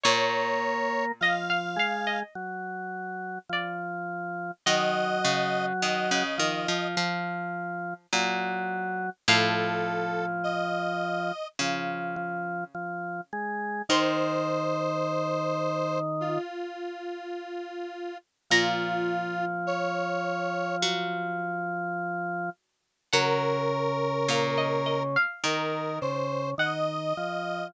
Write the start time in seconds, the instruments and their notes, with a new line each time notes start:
0.03 pizzicato strings A#2 C#5, drawbar organ A#3, lead 1 (square) C#5
1.20 drawbar organ F3, pizzicato strings D#5, lead 1 (square) F5
1.50 pizzicato strings F5
1.76 drawbar organ G#3, pizzicato strings F5
2.07 pizzicato strings D#5
2.35 drawbar organ F#3
3.49 drawbar organ F3, pizzicato strings D5
4.66 pizzicato strings D#3 D#5, drawbar organ F#3, lead 1 (square) D#5
5.25 pizzicato strings C#3
5.82 pizzicato strings D#3, lead 1 (square) D#5
6.11 pizzicato strings C#3
6.38 pizzicato strings D#3, drawbar organ F3
6.68 pizzicato strings F3
6.97 pizzicato strings F3
8.12 pizzicato strings A#2, drawbar organ F#3
9.28 pizzicato strings A2 F5, drawbar organ F3, lead 1 (square) A4
10.44 lead 1 (square) D#5
11.59 pizzicato strings C#3, drawbar organ F3
12.16 drawbar organ F3
12.75 drawbar organ F3
13.33 drawbar organ G#3
13.89 drawbar organ D#3, pizzicato strings D#3 C6, lead 1 (square) C5
16.20 lead 1 (square) F4
18.50 pizzicato strings A#2 A#5, drawbar organ F3, lead 1 (square) F4
19.67 lead 1 (square) C#5
20.82 pizzicato strings F#3
23.12 drawbar organ C#3, pizzicato strings F#3 F#5, lead 1 (square) A#4
24.28 pizzicato strings A#2 F5
24.58 pizzicato strings D#5
24.86 pizzicato strings D#5
25.16 pizzicato strings F5
25.44 pizzicato strings D#3, drawbar organ D#3, lead 1 (square) A#4
26.01 drawbar organ C#3, lead 1 (square) C5
26.58 drawbar organ D#3, lead 1 (square) D#5, pizzicato strings F#5
27.17 drawbar organ F3